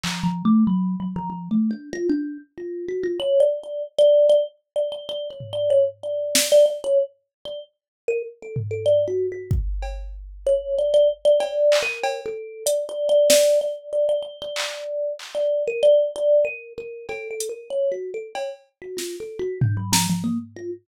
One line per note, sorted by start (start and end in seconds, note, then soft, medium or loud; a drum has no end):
0.04 0.23 F3 medium
0.04 clap medium
0.24 0.43 F3 medium
0.45 0.64 A3 loud
0.67 0.96 F#3 medium
1.00 1.14 F#3 medium
1.16 1.29 F3 loud
1.30 1.49 F3 medium
1.51 1.70 A3 medium
1.71 1.90 D4 medium
1.93 2.07 F4 loud
2.09 2.38 D4 medium
2.58 2.86 F4 medium
2.89 3.03 F#4 medium
3.03 3.18 F4 medium
3.20 3.39 C#5 loud
3.40 3.59 D5 medium
3.64 3.83 D5 medium
3.99 4.27 D5 loud
4.29 4.44 D5 loud
4.76 4.90 D5 medium
4.92 5.06 D5 medium
5.09 5.28 D5 loud
5.31 5.49 C#5 medium
5.40 floor tom medium
5.53 5.72 D5 medium
5.70 5.84 C#5 medium
6.03 6.46 D5 medium
6.35 snare loud
6.52 6.65 D5 loud
6.66 6.80 D5 medium
6.84 6.98 C#5 loud
7.45 7.60 D5 medium
8.08 8.22 A#4 loud
8.43 8.57 A4 medium
8.56 floor tom medium
8.71 8.85 A4 medium
8.86 9.05 D5 medium
9.08 9.27 F#4 medium
9.32 9.51 F#4 medium
9.51 kick loud
9.83 cowbell medium
10.47 10.75 C#5 loud
10.79 10.93 D5 medium
10.94 11.08 D5 loud
11.25 11.39 D5 loud
11.40 11.78 D5 loud
11.40 cowbell medium
11.72 clap loud
11.83 12.21 A#4 loud
12.04 cowbell loud
12.26 12.64 A4 medium
12.66 12.85 D5 medium
12.66 closed hi-hat loud
12.89 13.08 D5 medium
13.09 13.28 D5 loud
13.30 13.59 D5 loud
13.30 snare loud
13.61 13.90 D5 medium
13.93 14.07 D5 medium
14.09 14.22 D5 medium
14.23 14.37 D5 medium
14.42 15.13 D5 loud
14.56 clap loud
15.19 clap medium
15.35 15.63 D5 medium
15.68 15.82 A#4 medium
15.83 16.11 D5 loud
16.16 16.44 D5 loud
16.45 16.73 A#4 medium
16.78 17.06 A#4 medium
17.09 17.28 A4 loud
17.09 cowbell medium
17.31 17.50 A4 medium
17.40 closed hi-hat medium
17.49 17.68 A#4 medium
17.70 17.89 C#5 medium
17.92 18.11 F#4 medium
18.14 18.33 A4 medium
18.35 18.49 C#5 medium
18.35 cowbell medium
18.82 18.96 F#4 medium
18.97 19.16 F4 medium
18.97 snare medium
19.20 19.39 A4 medium
19.39 19.58 F#4 loud
19.61 19.76 D4 medium
19.61 floor tom loud
19.77 19.91 F#3 medium
19.93 20.07 F3 loud
19.93 snare loud
20.10 20.24 F3 medium
20.24 20.38 A#3 medium
20.56 20.71 F4 medium